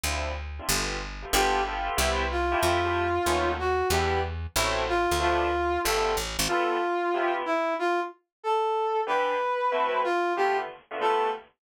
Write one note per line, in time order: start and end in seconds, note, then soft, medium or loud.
0.03 0.60 D2 medium
0.03 0.30 C4 medium
0.03 0.30 D4 medium
0.03 0.30 E4 medium
0.03 0.30 F4 medium
0.59 0.66 C4 medium
0.59 0.66 D4 medium
0.59 0.66 E4 medium
0.59 0.66 F4 medium
0.69 1.25 G1 medium
0.69 0.95 A3 medium
0.69 0.95 B3 medium
0.69 0.95 F4 medium
0.69 0.95 G4 medium
1.22 1.29 A3 medium
1.22 1.29 B3 medium
1.22 1.29 F4 medium
1.22 1.29 G4 medium
1.33 1.90 G1 medium
1.33 1.59 B3 loud
1.33 1.59 F4 loud
1.33 1.59 G4 loud
1.33 1.62 G4 medium
1.33 1.59 A4 loud
1.65 1.92 B3 medium
1.65 1.92 F4 loud
1.65 1.92 G4 loud
1.65 1.92 A4 medium
1.97 2.55 C2 medium
1.97 2.23 B3 loud
1.97 2.23 C4 loud
1.97 2.23 E4 loud
1.97 2.23 G4 loud
2.31 2.60 F4 medium
2.52 2.77 A3 loud
2.52 2.77 E4 loud
2.52 2.77 F4 loud
2.52 2.77 G4 loud
2.61 3.19 F2 medium
2.61 3.51 F4 medium
2.84 3.03 A3 loud
2.84 3.03 E4 medium
2.84 3.03 F4 medium
2.84 3.03 G4 loud
3.26 3.83 D#2 medium
3.26 3.52 A3 loud
3.26 3.52 B3 loud
3.26 3.52 C#4 loud
3.26 3.52 D#4 loud
3.59 3.88 F#4 medium
3.90 4.47 E2 medium
3.90 4.17 G3 loud
3.90 4.17 B3 loud
3.90 4.17 D4 loud
3.90 4.17 E4 loud
3.90 4.21 G4 medium
4.56 5.07 A1 medium
4.56 4.82 F#3 loud
4.56 4.82 A3 loud
4.56 4.82 C4 loud
4.56 4.82 E4 loud
4.89 5.17 F4 medium
5.11 5.78 D2 medium
5.20 5.46 F3 loud
5.20 5.46 A3 loud
5.20 5.46 B3 loud
5.20 5.46 D4 loud
5.20 5.80 F4 medium
5.84 6.17 G1 medium
5.84 6.11 F3 loud
5.84 6.11 G3 loud
5.84 6.11 A3 loud
5.84 6.11 B3 loud
5.84 6.14 A4 medium
6.17 6.37 A1 medium
6.39 6.48 G#1 medium
6.48 6.75 G3 medium
6.48 6.75 B3 loud
6.48 7.34 F4 medium
6.48 6.75 F4 loud
6.48 6.75 A4 loud
7.14 7.40 C3 loud
7.14 7.40 B3 loud
7.14 7.40 E4 medium
7.14 7.40 G4 loud
7.46 7.74 E4 medium
7.79 8.00 F4 medium
8.43 9.01 A4 medium
9.07 9.33 E3 loud
9.07 9.33 B3 medium
9.07 9.33 D4 medium
9.07 9.33 G4 loud
9.07 10.01 B4 medium
9.72 9.98 A3 loud
9.72 9.98 C4 loud
9.72 9.98 E4 loud
9.72 9.98 F#4 loud
10.04 10.33 F4 medium
10.36 10.63 D3 loud
10.36 10.63 A3 medium
10.36 10.63 B3 loud
10.36 10.63 F4 loud
10.36 10.57 G4 medium
10.91 10.98 D3 medium
10.91 10.98 A3 medium
10.91 10.98 B3 loud
10.91 10.98 F4 medium
11.01 11.27 G3 loud
11.01 11.27 A3 loud
11.01 11.27 B3 loud
11.01 11.27 F4 medium
11.01 11.30 A4 medium